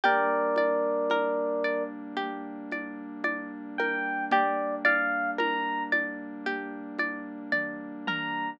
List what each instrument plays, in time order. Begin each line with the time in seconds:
0.04 pad 2 (warm) G3 A#3 D4, pizzicato strings G4, electric piano 1 A#4 D5, low conga
0.56 pizzicato strings D5, high conga
1.10 pizzicato strings A#4, high conga
1.64 pizzicato strings D5
2.17 pizzicato strings G4, low conga
2.72 pizzicato strings D5, high conga
3.24 pizzicato strings D5, high conga
3.78 pizzicato strings A#4, electric piano 1 G5, high conga
4.31 pizzicato strings G4, electric piano 1 D5, low conga
4.85 pizzicato strings D5, electric piano 1 F5, high conga
5.38 pizzicato strings A#4, electric piano 1 A#5, high conga
5.92 pizzicato strings D5, high conga
6.46 pizzicato strings G4, low conga
6.99 pizzicato strings D5, high conga
7.52 pizzicato strings D5, kick, high tom
8.07 pizzicato strings A#4, electric piano 1 A#5, high tom